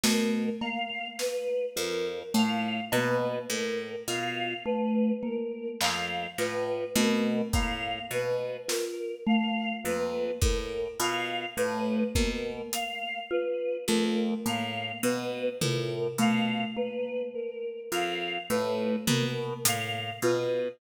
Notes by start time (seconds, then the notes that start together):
0.03 B2 A3 A#4, snare
0.61 A#3 F5, cowbell
1.19 B4, snare
1.76 F2 F4 A#4
2.34 A2 A3 F5
2.92 B2 A#3 B4, cowbell
3.50 A2 A#4
4.07 B2 F4 F5
4.65 A3 B4
5.23 A#3 A#4
5.81 F2 F5, clap
6.38 A2 F4 B4, clap
6.95 B2 A3 A#4, high tom
7.53 A2 A#3 F5, kick
8.11 B2 B4
8.68 F4 A#4, snare
9.26 A3 F5
9.84 F2 A#3 B4
10.41 A2 A#4, kick
11.00 B2 F4 F5
11.57 A2 A3 B4
12.15 B2 A#3 A#4, kick
12.73 F5, closed hi-hat
13.31 F4 B4
13.88 F2 A3 A#4
14.46 A2 A#3 F5
15.03 B2 B4
15.61 A2 F4 A#4, floor tom
16.18 B2 A3 F5
16.76 A#3 B4
17.34 A#4
17.92 F2 F4 F5
18.50 A2 A3 B4
19.07 B2 A#3 A#4, floor tom
19.65 A2 F5, closed hi-hat
20.22 B2 F4 B4